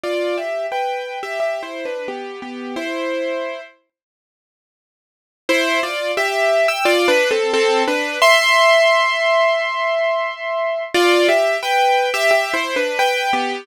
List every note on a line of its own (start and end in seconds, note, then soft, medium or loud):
0.04 0.36 F4 medium
0.04 0.36 D5 medium
0.38 0.66 G4 medium
0.38 0.66 E5 medium
0.72 1.19 B4 medium
0.72 1.19 G5 medium
1.23 1.39 G4 medium
1.23 1.39 E5 medium
1.40 1.62 G4 medium
1.40 1.62 E5 medium
1.63 1.84 E4 medium
1.63 1.84 C5 medium
1.85 2.07 D4 medium
1.85 2.07 B4 medium
2.08 2.40 B3 medium
2.08 2.40 G4 medium
2.42 2.75 B3 medium
2.42 2.75 G4 medium
2.76 3.61 E4 medium
2.76 3.61 C5 medium
5.49 5.80 E4 loud
5.49 5.80 C5 loud
5.83 6.12 F4 loud
5.83 6.12 D5 loud
6.17 6.67 G4 loud
6.17 6.67 E5 loud
6.68 6.85 G5 medium
6.68 6.85 E6 loud
6.85 7.07 F4 loud
6.85 7.07 D5 loud
7.08 7.30 D4 loud
7.08 7.30 B4 loud
7.31 7.52 C4 loud
7.31 7.52 A4 loud
7.54 7.83 C4 loud
7.54 7.83 A4 loud
7.88 8.19 D4 loud
7.88 8.19 B4 loud
8.22 10.83 E5 loud
8.22 10.83 C6 loud
10.94 11.27 F4 loud
10.94 11.27 D5 loud
11.29 11.57 G4 loud
11.29 11.57 E5 loud
11.63 12.10 B4 loud
11.63 12.10 G5 loud
12.14 12.30 G4 loud
12.14 12.30 E5 loud
12.31 12.52 G4 loud
12.31 12.52 E5 loud
12.54 12.75 E4 loud
12.54 12.75 C5 loud
12.76 12.98 D4 loud
12.76 12.98 B4 loud
12.99 13.31 B4 loud
12.99 13.31 G5 loud
13.33 13.65 B3 loud
13.33 13.65 G4 loud